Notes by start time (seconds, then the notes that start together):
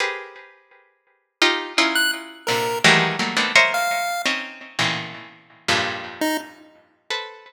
0.00 G4 G#4 A#4 B4 C5
1.42 D#4 F4 G4
1.78 C#4 D#4 E4 F4
1.95 F#6
2.47 A#2 C3 D3 A#4
2.84 D#3 E3 F#3 G3 G#3 A3
3.19 F#3 G3 A3 A#3
3.37 A3 A#3 B3 C4 D4 D#4
3.56 A#4 C5 C#5 D#5 E5
3.74 F5
4.26 C4 C#4 D#4
4.79 A2 A#2 B2 C#3 D#3 E3
5.68 F2 G2 G#2 A#2
6.21 D#4
7.10 A4 B4 C5